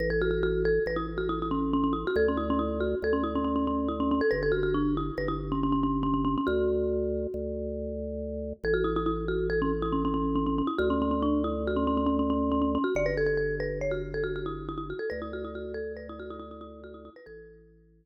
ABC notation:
X:1
M:5/4
L:1/16
Q:1/4=139
K:Amix
V:1 name="Marimba"
B A F F F2 A2 B E z F E E C2 C C E F | A C E C E2 F2 A C E C C C C2 E C C A | B A F F D2 E2 B E z C C C C2 C C C C | F14 z6 |
A F E E E2 F2 A C z E C C C2 C C C E | F C C C D2 E2 F C C C C C C2 C C C F | d B A A A2 B2 c F z A F F E2 E E F A | B E F E F2 A2 B E F E E E E2 F E E B |
A16 z4 |]
V:2 name="Drawbar Organ" clef=bass
A,,,8 A,,,12 | D,,8 D,,12 | G,,,8 G,,,12 | D,,8 D,,12 |
A,,,20 | D,,20 | G,,,20 | D,,20 |
A,,,8 z12 |]